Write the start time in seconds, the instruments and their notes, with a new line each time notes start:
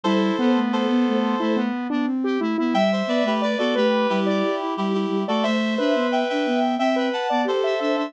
0.04 ocarina G3, lead 1 (square) E4, clarinet A4 C5
0.39 lead 1 (square) B3, ocarina B3
0.56 ocarina A3
0.73 clarinet A4 C5
0.89 ocarina B3
1.07 ocarina A3
1.40 ocarina A3, lead 1 (square) E4
1.56 lead 1 (square) B3
1.90 ocarina B3, lead 1 (square) D4
2.05 ocarina C4
2.24 lead 1 (square) G4
2.39 ocarina A3, lead 1 (square) E4
2.58 ocarina B3, lead 1 (square) E4
2.73 ocarina G3, clarinet E5 G5, lead 1 (square) E5
2.92 clarinet C5 E5
3.07 ocarina B3, clarinet B4 D5
3.23 ocarina A3, clarinet G4 B4
3.42 clarinet B4 D5, lead 1 (square) D5
3.58 ocarina B3, clarinet F#4 A4, lead 1 (square) D5
3.75 ocarina A3, clarinet G4 B4, lead 1 (square) B4
4.09 ocarina G3, clarinet E4 G4
4.26 lead 1 (square) D5
4.60 ocarina E4
4.77 ocarina G3, clarinet E4 G4
4.94 clarinet E4 G4
5.08 ocarina G3
5.27 ocarina A3, clarinet F#4 A4, lead 1 (square) D5
5.43 ocarina A3, clarinet C5 E5, lead 1 (square) E5
5.78 ocarina D4, lead 1 (square) B4
5.95 ocarina B3
6.12 clarinet E5 G5
6.29 ocarina D4, clarinet E5 G5
6.46 ocarina B3
6.78 ocarina C4, clarinet E5 G5, lead 1 (square) E5
6.96 lead 1 (square) B4
7.13 clarinet F#5 A5
7.30 ocarina B3, lead 1 (square) D5
7.44 ocarina G4, clarinet A4 C5
7.64 lead 1 (square) E5
7.80 ocarina D4, lead 1 (square) E5
7.97 ocarina D4, lead 1 (square) E5